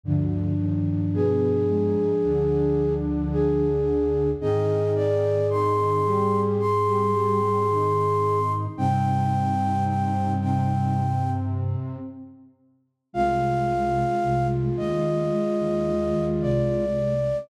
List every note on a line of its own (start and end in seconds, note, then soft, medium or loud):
0.03 0.52 D2 medium
0.03 1.97 G2 medium
0.03 0.52 D3 loud
0.03 3.67 F3 medium
0.03 3.67 D4 medium
0.59 1.04 D#2 medium
0.59 1.04 D#3 medium
1.13 1.63 B2 medium
1.13 1.63 B3 medium
1.13 2.93 G#4 medium
1.68 2.13 G#2 medium
1.68 2.13 G#3 loud
2.23 4.35 D2 medium
2.23 4.28 D3 medium
2.23 4.28 D4 medium
3.32 4.30 G#4 medium
4.40 8.67 G#2 medium
4.40 5.37 D#3 medium
4.40 8.40 C4 medium
4.40 5.37 D#4 loud
4.40 8.40 G#4 medium
4.40 4.91 D#5 medium
4.95 5.47 D5 medium
5.49 5.99 D#3 medium
5.49 5.99 D#4 medium
5.49 6.40 C6 medium
6.04 6.58 G3 medium
6.04 6.58 G4 medium
6.59 8.52 C6 medium
6.86 7.12 G3 medium
6.86 7.12 G4 medium
7.13 7.39 G3 medium
7.13 7.39 G4 medium
7.41 7.67 G3 medium
7.41 7.67 G4 medium
7.69 8.65 D#3 medium
7.69 8.65 D#4 medium
8.77 11.76 G2 medium
8.77 10.35 C3 medium
8.77 11.00 G3 medium
8.77 10.35 C4 medium
8.77 11.00 D#4 medium
8.77 9.84 G5 medium
9.87 10.32 G5 medium
10.41 11.96 C3 medium
10.41 11.96 C4 medium
10.41 11.30 G5 medium
13.13 14.02 C2 medium
13.13 14.02 C3 loud
13.13 15.24 G#3 medium
13.13 16.85 G#3 medium
13.13 16.85 F4 medium
13.13 14.47 F5 medium
14.22 14.69 C2 medium
14.22 14.69 C3 medium
14.76 15.27 D#2 medium
14.76 15.27 D#3 medium
14.76 16.25 D#5 medium
15.32 17.14 G#3 medium
15.60 15.85 D#2 medium
15.60 15.85 D#3 medium
15.86 16.12 D#2 medium
15.86 16.12 D#3 medium
16.13 16.39 D#2 medium
16.13 16.39 D#3 medium
16.41 17.31 C2 medium
16.41 17.31 C3 medium
16.41 17.37 D5 medium